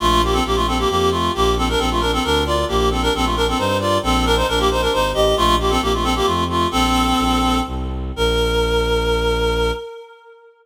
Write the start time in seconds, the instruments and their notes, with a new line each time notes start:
0.00 violin A#1, clarinet A3 F4
0.23 clarinet A#3 G4
0.33 clarinet C4 A4
0.45 violin A#1, clarinet A#3 G4
0.56 clarinet A3 F4
0.67 clarinet C4 A4
0.78 clarinet A#3 G4
0.89 violin F2, clarinet A#3 G4
1.11 clarinet A3 F4
1.34 violin A#1, clarinet A#3 G4
1.57 clarinet C4 A4
1.69 clarinet D4 A#4
1.79 violin A#1, clarinet C4 A4
1.90 clarinet A3 F4
2.00 clarinet D4 A#4
2.13 clarinet C4 A4
2.24 violin D2, clarinet D4 A#4
2.46 clarinet F4 D5
2.68 violin A#1, clarinet A#3 G4
2.91 clarinet C4 A4
3.02 clarinet D4 A#4
3.14 violin A#1, clarinet C4 A4
3.25 clarinet A3 F4
3.36 clarinet D4 A#4
3.47 clarinet C4 A4
3.58 violin G2, clarinet D#4 C5
3.80 clarinet F4 D5
4.03 violin A#1, clarinet C4 A4
4.25 clarinet D4 A#4
4.36 clarinet D#4 C5
4.47 violin A#1, clarinet D4 A#4
4.59 clarinet A#3 G4
4.71 clarinet D#4 C5
4.82 clarinet D4 A#4
4.93 violin G#1, clarinet D#4 C5
5.14 violin A1, clarinet G4 D#5
5.37 violin A#1, clarinet A3 F4
5.60 clarinet A#3 G4
5.70 clarinet C4 A4
5.81 violin A#1, clarinet A#3 G4
5.94 clarinet A3 F4
6.03 clarinet C4 A4
6.15 clarinet A#3 G4
6.26 violin F2, clarinet A3 F4
6.49 clarinet A3 F4
6.71 violin A#1, clarinet C4 A4
7.18 violin A#1
7.66 violin C2
8.16 violin A#1, clarinet A#4